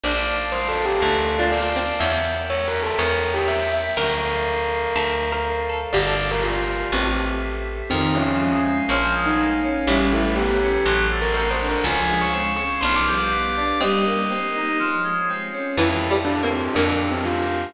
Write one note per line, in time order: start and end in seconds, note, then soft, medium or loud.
0.03 0.94 A#1 loud
0.03 0.27 D4 loud
0.03 1.01 A#4 medium
0.03 1.01 D5 medium
0.03 0.28 D5 loud
0.03 1.01 F5 medium
0.03 1.01 A5 medium
0.52 0.68 C5 loud
0.69 0.84 A4 medium
0.85 1.01 G4 loud
1.01 1.93 D2 loud
1.01 1.32 D4 medium
1.01 1.31 A4 medium
1.01 1.99 A#4 medium
1.01 1.99 D5 medium
1.01 1.99 F5 medium
1.01 1.99 A5 medium
1.39 1.71 D4 medium
1.39 1.51 F4 loud
1.52 2.00 D5 loud
1.76 1.99 C4 medium
2.00 2.91 E2 loud
2.00 2.98 A#4 medium
2.00 2.98 C#5 medium
2.00 2.22 C#5 medium
2.00 2.23 E5 loud
2.00 2.98 E5 medium
2.00 2.98 G5 medium
2.50 2.65 C#5 loud
2.68 2.83 A#4 medium
2.83 2.98 A4 loud
2.99 3.89 E2 loud
2.99 3.30 A#4 loud
2.99 3.96 A#4 medium
2.99 3.31 C#5 medium
2.99 3.96 C#5 medium
2.99 3.96 E5 medium
2.99 3.96 G5 medium
3.34 3.46 G4 loud
3.34 3.69 E5 medium
3.48 3.95 E5 loud
3.72 3.94 E5 medium
3.97 4.88 D2 medium
3.97 4.95 A4 medium
3.97 4.19 A#4 loud
3.97 4.95 A#4 medium
3.97 5.61 A#4 loud
3.97 4.95 D5 medium
3.97 4.95 F5 medium
4.95 5.86 D2 medium
4.95 5.93 A4 medium
4.95 5.30 A4 medium
4.95 5.93 C5 medium
4.95 5.93 D5 medium
4.95 5.93 F5 medium
5.32 5.68 A#4 medium
5.69 5.92 A4 medium
5.93 6.84 G1 loud
5.93 6.05 G4 loud
5.93 6.91 G4 medium
5.93 6.91 A#4 medium
5.93 6.23 D5 loud
5.93 6.91 D5 medium
5.93 6.91 F5 medium
6.06 6.56 A4 medium
6.31 6.43 A#4 loud
6.43 6.84 F4 medium
6.92 7.83 A1 loud
6.92 7.17 C4 medium
6.92 7.90 G4 medium
6.92 7.90 A4 medium
6.92 7.90 C5 medium
6.92 7.90 E5 medium
7.90 8.81 F2 loud
7.90 8.12 D#3 medium
7.90 8.14 C4 loud
7.90 8.88 C5 medium
7.90 8.88 D#5 medium
7.90 8.88 F5 medium
7.90 8.88 G#5 medium
8.15 8.38 F3 medium
8.15 8.57 C#4 loud
8.40 8.62 G#3 medium
8.64 8.86 C4 medium
8.89 9.79 A#1 loud
8.89 9.12 F3 medium
8.89 9.86 A#4 medium
8.89 9.86 C#5 medium
8.89 9.83 C#5 medium
8.89 9.86 F5 medium
8.89 9.86 G#5 medium
9.14 9.36 G#3 medium
9.26 9.38 D#4 medium
9.38 9.60 A#3 medium
9.63 9.85 C#4 medium
9.87 10.78 A1 loud
9.87 10.09 G3 medium
9.87 10.07 C#4 loud
9.87 10.28 E4 medium
9.87 10.85 A4 medium
9.87 10.85 B4 medium
9.87 10.85 C#5 medium
9.87 10.85 G5 medium
10.12 10.34 A3 medium
10.12 10.36 E4 medium
10.36 10.59 B3 medium
10.36 10.82 G4 medium
10.61 10.83 C#4 medium
10.86 11.76 A1 loud
10.86 11.08 F#3 medium
10.86 11.83 A4 medium
10.86 11.83 C5 medium
10.86 11.83 D5 medium
10.86 11.83 F#5 medium
11.11 11.33 A3 medium
11.22 11.33 A#4 medium
11.34 11.57 C4 medium
11.34 11.50 A#4 loud
11.51 11.66 C5 medium
11.60 11.83 D4 medium
11.68 11.84 A#4 loud
11.84 12.75 C#2 loud
11.84 12.07 F3 medium
11.84 12.81 G#4 medium
11.84 12.81 C5 medium
11.84 12.81 C#5 medium
11.84 12.81 F5 medium
11.84 12.16 G#5 loud
12.10 12.32 G#3 medium
12.22 12.33 C#6 medium
12.33 12.55 C4 medium
12.33 12.45 C#6 medium
12.57 12.80 C#4 medium
12.57 12.78 C#6 medium
12.81 13.73 B1 loud
12.81 13.05 F3 medium
12.81 13.69 D4 medium
12.81 13.80 G4 medium
12.81 13.80 B4 medium
12.81 13.80 D5 medium
12.81 13.80 F5 medium
12.81 12.93 C6 medium
12.96 13.06 D6 medium
13.07 13.30 G3 medium
13.07 13.78 D6 medium
13.31 13.53 B3 medium
13.56 13.78 D4 medium
13.81 14.04 G3 medium
13.81 14.27 C4 medium
13.81 14.78 G4 medium
13.81 14.78 A#4 medium
13.81 14.78 C5 medium
13.81 14.78 D#5 medium
13.81 14.78 D#5 loud
14.06 14.28 A#3 medium
14.30 14.52 C4 medium
14.54 14.76 D#4 medium
14.79 15.01 F3 medium
14.79 15.76 F4 medium
14.79 15.76 G#4 medium
14.79 15.76 C5 medium
14.79 15.76 C#5 medium
15.04 15.26 G#3 medium
15.29 15.51 C4 medium
15.52 15.75 C#4 medium
15.77 16.68 F2 loud
15.77 16.09 E3 loud
15.77 16.75 E4 medium
15.77 16.03 E4 loud
15.77 16.75 F4 medium
15.77 16.75 G4 medium
15.77 16.75 A4 medium
16.10 16.41 G3 medium
16.25 16.40 D4 loud
16.43 16.70 A#3 medium
16.43 16.58 C4 medium
16.58 16.74 C4 medium
16.75 17.66 F2 loud
16.75 17.71 A#3 medium
16.75 17.05 D4 loud
16.75 17.73 D4 medium
16.75 17.73 F4 medium
16.75 17.73 G4 medium
16.75 17.73 A#4 medium
17.11 17.23 C4 loud
17.25 17.73 F4 loud